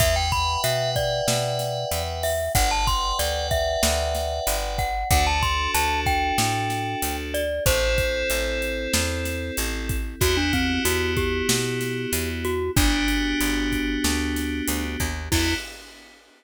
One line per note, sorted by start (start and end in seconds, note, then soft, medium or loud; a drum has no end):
0.00 0.57 E2 loud
0.00 2.31 B4 loud
0.00 0.15 E5 loud
0.00 2.31 E5 loud
0.00 2.31 F#5 medium
0.00 2.31 G5 loud
0.00 kick loud
0.00 closed hi-hat loud
0.16 0.31 G5 medium
0.32 0.61 B5 loud
0.32 kick loud
0.32 closed hi-hat medium
0.64 1.21 B2 medium
0.64 0.90 E5 medium
0.64 closed hi-hat loud
0.96 2.03 D5 loud
0.96 kick medium
0.96 closed hi-hat medium
1.28 1.85 B2 medium
1.28 snare loud
1.59 snare medium
1.59 closed hi-hat medium
1.91 2.49 E2 medium
1.91 closed hi-hat loud
2.23 2.52 E5 loud
2.23 open hi-hat medium
2.55 3.13 G1 loud
2.55 4.85 B4 medium
2.55 4.85 D5 medium
2.55 2.70 F#5 loud
2.55 4.85 F#5 loud
2.55 4.85 G5 medium
2.55 kick loud
2.55 closed hi-hat loud
2.71 2.86 A5 loud
2.87 3.18 C6 loud
2.87 kick loud
2.87 closed hi-hat medium
3.19 3.77 D2 medium
3.19 3.47 D5 loud
3.19 closed hi-hat loud
3.51 4.57 E5 loud
3.51 kick loud
3.51 closed hi-hat medium
3.83 4.40 D2 loud
3.83 snare loud
4.15 snare medium
4.15 closed hi-hat medium
4.47 5.04 G1 medium
4.47 closed hi-hat loud
4.78 5.09 F#5 loud
4.78 kick loud
4.78 closed hi-hat medium
5.11 5.68 D2 loud
5.11 7.41 D4 loud
5.11 7.41 F#4 loud
5.11 7.41 A4 loud
5.11 5.26 F#5 loud
5.11 kick loud
5.11 closed hi-hat loud
5.27 5.42 A5 loud
5.43 5.71 C6 medium
5.43 kick loud
5.43 closed hi-hat medium
5.74 6.32 D2 medium
5.74 6.00 A5 loud
5.74 closed hi-hat loud
6.06 7.16 G5 loud
6.06 kick loud
6.06 closed hi-hat medium
6.38 6.95 A2 medium
6.38 snare loud
6.70 snare medium
6.70 closed hi-hat medium
7.02 7.60 D2 medium
7.02 closed hi-hat loud
7.34 7.64 D5 loud
7.34 closed hi-hat loud
7.66 8.23 A1 loud
7.66 9.96 C4 loud
7.66 9.96 E4 medium
7.66 9.96 A4 medium
7.66 9.56 C5 loud
7.66 kick loud
7.66 closed hi-hat loud
7.98 kick loud
7.98 closed hi-hat medium
8.30 8.88 A1 medium
8.30 closed hi-hat loud
8.62 closed hi-hat medium
8.93 9.51 E2 medium
8.93 snare loud
9.25 snare medium
9.25 closed hi-hat medium
9.57 10.15 A1 medium
9.57 closed hi-hat loud
9.89 kick loud
9.89 closed hi-hat loud
10.20 10.79 E2 medium
10.20 12.50 B3 loud
10.20 12.50 E4 medium
10.20 12.50 F#4 medium
10.20 10.36 F#4 loud
10.20 12.50 G4 medium
10.20 kick loud
10.20 closed hi-hat loud
10.37 10.52 D4 loud
10.53 10.82 C4 loud
10.53 kick loud
10.53 closed hi-hat medium
10.85 11.43 E2 medium
10.85 11.14 F#4 loud
10.85 closed hi-hat loud
11.17 12.30 G4 loud
11.17 kick loud
11.17 closed hi-hat medium
11.49 12.06 B2 medium
11.49 snare loud
11.81 snare medium
11.81 closed hi-hat medium
12.13 12.70 E2 medium
12.13 closed hi-hat loud
12.45 12.71 F#4 loud
12.45 closed hi-hat medium
12.76 13.34 G1 loud
12.76 15.06 B3 loud
12.76 15.06 D4 medium
12.76 14.84 D4 loud
12.76 15.06 F#4 medium
12.76 15.06 G4 loud
12.76 kick loud
12.76 closed hi-hat loud
13.08 closed hi-hat medium
13.41 13.98 G1 medium
13.41 closed hi-hat loud
13.72 kick medium
13.72 closed hi-hat medium
14.04 14.62 D2 medium
14.04 snare loud
14.36 snare medium
14.36 closed hi-hat loud
14.68 14.97 D2 medium
14.68 closed hi-hat loud
15.00 15.29 D#2 medium
15.00 kick medium
15.00 closed hi-hat medium
15.32 15.54 E2 loud
15.32 15.55 B3 medium
15.32 15.54 E4 loud
15.32 15.55 E4 loud
15.32 15.55 F#4 medium
15.32 15.55 G4 medium
15.32 kick loud
15.32 crash loud